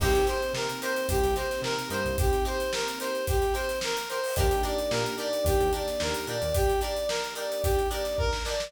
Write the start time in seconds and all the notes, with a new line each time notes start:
0.00 C2 A#3 C4 D#4 G4 A#4, kick, crash
0.05 C5
0.15 snare, closed hi-hat
0.27 D#4 G4 A#4 C5, closed hi-hat
0.42 closed hi-hat
0.53 C3 A#4, snare
0.69 closed hi-hat
0.82 D#4 G4 A#4 C5, closed hi-hat
0.96 closed hi-hat
1.08 C2 G4, kick, closed hi-hat
1.23 C2, snare, closed hi-hat
1.35 D#4 G4 A#4 C5, closed hi-hat
1.40 C5
1.51 snare, closed hi-hat
1.62 C3 A#4, snare
1.79 closed hi-hat
1.90 G2 D#4 G4 A#4 C5, snare, closed hi-hat
1.94 C5
2.05 C2, closed hi-hat
2.18 G4, kick, closed hi-hat
2.33 snare, closed hi-hat
2.45 D#4 G4 A#4 C5, closed hi-hat
2.60 snare, closed hi-hat
2.73 A#4, snare
2.88 closed hi-hat
2.99 D#4 G4 A#4 C5, closed hi-hat
3.04 C5
3.15 closed hi-hat
3.27 G4, kick, closed hi-hat
3.42 snare, closed hi-hat
3.54 D#4 G4 A#4 C5, closed hi-hat
3.69 snare, closed hi-hat
3.81 A#4, snare
3.97 closed hi-hat
4.09 D#4 G4 A#4 C5, closed hi-hat
4.14 C5
4.24 open hi-hat
4.36 D#2 A#3 D4 D#4 G4, kick, closed hi-hat
4.40 A#4
4.51 closed hi-hat
4.63 D4 D#4 G4 A#4 D5, closed hi-hat
4.78 closed hi-hat
4.91 A#2 A#4, snare
5.06 closed hi-hat
5.18 D4 D#4 G4 A#4 D5, closed hi-hat
5.33 closed hi-hat
5.44 D#2 G4, kick, closed hi-hat
5.60 D#2, closed hi-hat
5.73 D4 D#4 G4 A#4 D5, closed hi-hat
5.87 snare, closed hi-hat
6.00 D#2 A#4, snare
6.14 snare, closed hi-hat
6.27 A#2 D4 D#4 G4 A#4 D5, closed hi-hat
6.42 D#2, closed hi-hat
6.54 G4, kick, closed hi-hat
6.70 closed hi-hat
6.81 D4 D#4 G4 A#4 D5, closed hi-hat
6.97 closed hi-hat
7.09 A#4, snare
7.24 closed hi-hat
7.35 D4 D#4 G4 A#4 D5, closed hi-hat
7.51 snare, closed hi-hat
7.63 G4, kick, closed hi-hat
7.79 closed hi-hat
7.90 D4 D#4 G4 A#4 D5, closed hi-hat
8.05 snare, closed hi-hat
8.18 A#4, kick
8.33 snare
8.45 D4 D#4 G4 D5, snare
8.49 A#4
8.60 snare